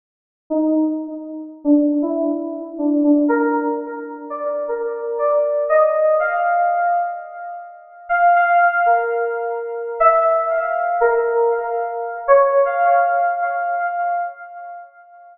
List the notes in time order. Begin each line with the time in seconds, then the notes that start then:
0.50 D#4
1.64 D4
2.02 E4
2.78 D4
3.03 D4
3.28 A#4
4.30 D5
4.68 A#4
5.18 D5
5.69 D#5
6.19 F5
8.09 F5
8.35 F5
8.60 F5
8.86 A#4
10.00 E5
10.50 F5
11.00 A#4
11.51 F5
12.28 C#5
12.65 F5
13.41 F5
13.79 F5